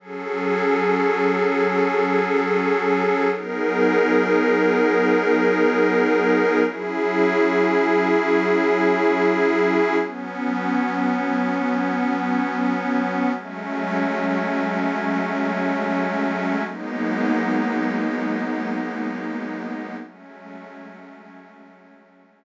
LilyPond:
\new Staff { \time 4/4 \key fis \dorian \tempo 4 = 72 <fis cis' gis' a'>1 | <fis b dis' gis' ais'>1 | <fis cis' e' gis'>1 | <fis b cis'>1 |
<fis gis a cis'>1 | <fis gis ais b dis'>1 | <fis gis a cis'>1 | }